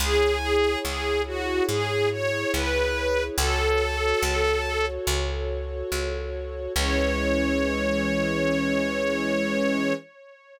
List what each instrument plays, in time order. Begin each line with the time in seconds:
0.00 electric bass (finger) C#2, string ensemble 1 E4 G#4 C#5
0.84 electric bass (finger) C#2, string ensemble 1 G#4
1.27 string ensemble 1 F#4
1.69 electric bass (finger) G#2, string ensemble 1 G#4
2.11 string ensemble 1 C#5
2.53 electric bass (finger) C#2, string ensemble 1 B4
3.38 electric bass (finger) C#2, string ensemble 1 F#4 A4 C#5
4.23 electric bass (finger) C#2
5.07 electric bass (finger) C#2
5.92 electric bass (finger) C#2
6.76 electric bass (finger) C#2, string ensemble 1 E3 G#3 C#4 C#5